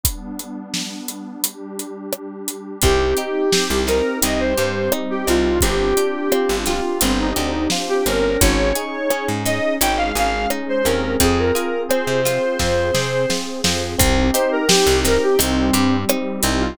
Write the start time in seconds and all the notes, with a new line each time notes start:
0.03 G3 B3 D4, kick, closed hi-hat
0.39 closed hi-hat
0.74 snare
1.08 closed hi-hat
1.43 G3 D4 G4, closed hi-hat
1.79 closed hi-hat
2.13 cross-stick
2.48 closed hi-hat
2.82 C2 C4 D#4 G4, kick, closed hi-hat
3.17 D#4 G4, closed hi-hat
3.52 C4 G4, snare
3.70 C2
3.87 C4 D#4 A#4, snare, closed hi-hat
4.22 C2 G3 C4 D#4 G4 D#5, closed hi-hat
4.40 C5
4.58 G2 G4 C5, closed hi-hat
4.92 C4 D#4, cross-stick
5.10 G4
5.27 C2 C4 D#4 F4, closed hi-hat
5.61 G1 C4 D4 F4 G4, kick, closed hi-hat
5.97 D4 G4, closed hi-hat
6.32 C4 F4, cross-stick
6.49 G1
6.66 F4 G4, snare, closed hi-hat
7.01 G1 C4 D4 G4 C5, closed hi-hat
7.20 D#4
7.36 D2 D4 D#4 G4, closed hi-hat
7.70 F4, snare
7.89 G4
8.06 G1 C4 C#4 A#4, closed hi-hat
8.40 G#1 C#4 D#4 G#4 C#5, kick, closed hi-hat
8.75 D#4 G#4, closed hi-hat
9.10 C#4 G#4, cross-stick
9.28 G#2
9.45 C#4 D#4 D#5, snare, closed hi-hat
9.81 G#1 G#3 C#4 D#4 G#4 G5, closed hi-hat
9.97 F5
10.15 G#1 G#4 F5, closed hi-hat
10.50 C#4 D#4, cross-stick
10.69 C5
10.85 D#2 C4 C#4 A#4, closed hi-hat
11.20 F2 C4 F4 G#4, kick, closed hi-hat
11.39 A#4
11.55 F4 G#4, closed hi-hat
11.89 C4 G#4 C5, cross-stick
12.07 C3
12.25 C4 F4, snare, closed hi-hat
12.59 F2 C4 F4 G#4 C5, kick, snare
12.94 C3 G#4, snare
13.30 C4 F4, snare
13.64 F2 C4 F4, snare
13.99 C2 C4 D#4 G4, kick, closed hi-hat
14.34 D#4 G4 C5, closed hi-hat
14.52 A#4
14.68 C4 G4, snare
14.87 C2
15.05 C4 D#4 A#4, snare, closed hi-hat
15.23 G4
15.39 C2 G3 C4 D#4 G4, closed hi-hat
15.73 G2 G4, closed hi-hat
16.09 C4 D#4, cross-stick
16.43 C2 C4 D#4, closed hi-hat
16.61 F4